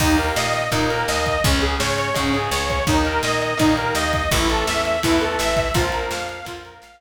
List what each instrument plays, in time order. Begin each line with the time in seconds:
0.00 electric bass (finger) D#2, overdriven guitar D#3 A#3, lead 2 (sawtooth) D#4, kick, crash
0.18 lead 2 (sawtooth) A#4, ride
0.36 electric bass (finger) A#2, lead 2 (sawtooth) D#5, snare
0.53 lead 2 (sawtooth) D#5, ride
0.72 electric bass (finger) A#2, overdriven guitar D#3 A#3, lead 2 (sawtooth) D#4, kick, ride
0.90 lead 2 (sawtooth) A#4, ride
1.08 electric bass (finger) D#2, lead 2 (sawtooth) D#5, snare
1.26 lead 2 (sawtooth) D#5, kick, ride
1.44 electric bass (finger) C#2, overdriven guitar C#3 G#3, lead 2 (sawtooth) C#4, kick, ride
1.61 lead 2 (sawtooth) G#4, ride
1.80 electric bass (finger) G#2, lead 2 (sawtooth) C#5, snare
1.98 lead 2 (sawtooth) C#5, ride
2.14 electric bass (finger) G#2, overdriven guitar C#3 G#3, lead 2 (sawtooth) C#4, kick, ride
2.34 lead 2 (sawtooth) G#4, ride
2.51 electric bass (finger) C#2, lead 2 (sawtooth) C#5, snare
2.69 lead 2 (sawtooth) C#5, kick, ride
2.87 electric bass (finger) D#2, overdriven guitar D#3 A#3, lead 2 (sawtooth) D#4, kick, ride
3.05 lead 2 (sawtooth) A#4, ride
3.23 electric bass (finger) A#2, lead 2 (sawtooth) D#5, snare
3.41 lead 2 (sawtooth) D#5, ride
3.57 electric bass (finger) A#2, overdriven guitar D#3 A#3, lead 2 (sawtooth) D#4, kick, ride
3.77 lead 2 (sawtooth) A#4, ride
3.95 electric bass (finger) D#2, lead 2 (sawtooth) D#5, snare
4.13 lead 2 (sawtooth) D#5, kick, ride
4.31 electric bass (finger) A1, overdriven guitar E3 A3, lead 2 (sawtooth) E4, kick, ride
4.49 lead 2 (sawtooth) A4, ride
4.67 electric bass (finger) E2, lead 2 (sawtooth) E5, snare
4.85 lead 2 (sawtooth) E5, ride
5.03 electric bass (finger) E2, overdriven guitar E3 A3, lead 2 (sawtooth) E4, kick, ride
5.21 lead 2 (sawtooth) A4, ride
5.39 electric bass (finger) A1, lead 2 (sawtooth) E5, snare
5.57 lead 2 (sawtooth) E5, kick, ride
5.74 electric bass (finger) A#1, overdriven guitar F3 A#3, lead 2 (sawtooth) F4, kick, ride
5.92 lead 2 (sawtooth) A#4, ride
6.11 electric bass (finger) F2, lead 2 (sawtooth) F5, snare
6.29 lead 2 (sawtooth) F5, ride
6.45 electric bass (finger) F2, overdriven guitar F3 A#3, lead 2 (sawtooth) F4, kick, ride
6.65 lead 2 (sawtooth) A#4, ride
6.82 electric bass (finger) A#1, lead 2 (sawtooth) F5, snare